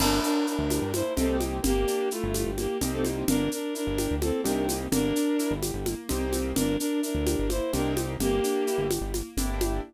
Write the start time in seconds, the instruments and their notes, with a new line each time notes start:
0.00 synth bass 1 G1, acoustic grand piano A#3, violin D4 A#4, crash, low conga, shaker
0.23 acoustic grand piano D4, violin D4 A#4, shaker
0.47 violin D4 A#4, acoustic grand piano E4, shaker
0.59 synth bass 1 D2
0.69 acoustic grand piano G4, high conga, shaker
0.82 synth bass 1 G2
0.92 acoustic grand piano A#3, violin E4 C5, high conga, shaker
1.17 synth bass 1 C2, acoustic grand piano A#3 C4 D#4 G4, violin C4 A4, low conga, shaker
1.41 high conga, shaker
1.62 synth bass 1 G1, acoustic grand piano A#3, violin A#3 G4, low conga, shaker
1.87 acoustic grand piano D4, shaker
2.11 violin A3 F4, acoustic grand piano E4, shaker
2.24 synth bass 1 G1
2.34 acoustic grand piano G4, high conga, shaker
2.46 synth bass 1 G1
2.58 violin A#3 G4, acoustic grand piano A#3, high conga, shaker
2.81 synth bass 1 C2, acoustic grand piano A#3 C4 D#4 G4, low conga, shaker
2.93 violin C4 A4
3.04 high conga, shaker
3.28 synth bass 1 G1, acoustic grand piano A#3, violin D4 A#4, low conga, shaker
3.51 acoustic grand piano D4, violin D4 A#4, shaker
3.74 violin D4 A#4, acoustic grand piano E4, shaker
3.87 synth bass 1 G1
3.98 acoustic grand piano G4, high conga, shaker
4.11 synth bass 1 D2
4.21 acoustic grand piano A#3, violin C4 A4, high conga, shaker
4.44 synth bass 1 C2, acoustic grand piano A#3 C4 D#4 G4, violin D4 A#4, low conga, shaker
4.69 high conga, shaker
4.92 synth bass 1 G1, acoustic grand piano A#3, violin D4 A#4, low conga, shaker
5.16 acoustic grand piano D4, shaker
5.39 acoustic grand piano E4, shaker
5.51 synth bass 1 G1
5.62 acoustic grand piano G4, high conga, shaker
5.74 synth bass 1 G1
5.86 acoustic grand piano A#3, high conga, shaker
6.09 synth bass 1 C2, acoustic grand piano A#3 C4 D#4 G4, low conga, shaker
6.33 high conga, shaker
6.55 synth bass 1 G1, acoustic grand piano A#3, violin D4 A#4, low conga, shaker
6.80 violin D4 A#4, acoustic grand piano D4, shaker
7.02 violin D4 A#4, acoustic grand piano E4, shaker
7.15 synth bass 1 D2
7.26 acoustic grand piano G4, high conga, shaker
7.39 synth bass 1 G1
7.49 acoustic grand piano A#3, violin E4 C5, high conga, shaker
7.73 synth bass 1 C2, acoustic grand piano A#3 C4 D#4 G4, violin D4 A#4, low conga, shaker
7.97 high conga, shaker
8.20 synth bass 1 G1, violin A#3 G4, acoustic grand piano A#3, low conga, shaker
8.44 acoustic grand piano D4, shaker
8.67 acoustic grand piano E4, shaker
8.78 synth bass 1 G1
8.90 acoustic grand piano G4, high conga, shaker
9.01 synth bass 1 G1
9.14 acoustic grand piano A#3, high conga, shaker
9.37 synth bass 1 G1, acoustic grand piano A#3 D4 E4 G4, low conga, shaker
9.61 high conga, shaker